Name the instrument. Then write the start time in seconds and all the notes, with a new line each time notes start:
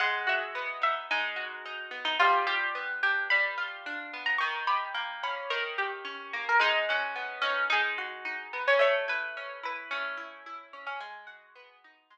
acoustic guitar (steel)
0.00 G#3 F#5
0.27 F#4 E5
0.55 B3
0.82 D#4 E5
1.11 G#3 D#4
1.36 F#4
1.65 D#4
1.91 B3
2.05 D#4
2.19 G3 F4
2.47 F4 G4
2.75 B3
3.03 D4 G4
3.30 G3 B5
3.58 F4
3.86 D4
4.13 B3
4.26 A#5
4.38 D#3 C#6
4.67 G4 B5
4.94 A#3
5.23 C#4 B5
5.50 D#3 A#4
5.78 G4
6.05 C#4
6.33 A#3
6.49 A#4
6.60 G#3 D#4
6.89 C#4 F#4
7.15 B3
7.42 C#4 D#4
7.70 G#3 D#4
7.98 F#4
8.25 D#4
8.53 B3
8.68 C#4
8.79 A3 C#5
9.08 E4 B4
9.37 C#4
9.63 E4 B4
9.91 A3 C#4
10.17 E4
10.46 E4
10.73 C#4
10.87 C#4
11.00 G#3 G#4
11.27 F#4
11.56 B3
11.84 D#4
12.10 G#3